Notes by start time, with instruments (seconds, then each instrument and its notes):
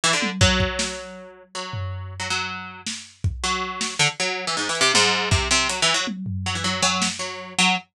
0.04 pizzicato strings E3
0.13 pizzicato strings D3
0.22 high tom
0.41 pizzicato strings F#3, kick
0.60 kick
0.79 snare
1.55 pizzicato strings F#3
1.73 floor tom
2.20 pizzicato strings F#3
2.30 pizzicato strings F#3
2.87 snare
3.24 kick
3.44 pizzicato strings F#3
3.81 snare
3.99 pizzicato strings D3
4.20 pizzicato strings F#3
4.47 pizzicato strings E3
4.57 pizzicato strings G#2
4.69 pizzicato strings E3
4.75 closed hi-hat
4.81 pizzicato strings C3
4.94 pizzicato strings G#2, high tom
5.31 pizzicato strings C3, kick
5.51 pizzicato strings C3, cowbell
5.69 pizzicato strings F#3, closed hi-hat
5.82 pizzicato strings E3
5.94 pizzicato strings F#3
6.07 high tom
6.26 floor tom
6.46 pizzicato strings F#3
6.55 pizzicato strings E3
6.64 pizzicato strings F#3
6.83 pizzicato strings F#3, cowbell
7.02 snare
7.19 pizzicato strings F#3
7.59 pizzicato strings F#3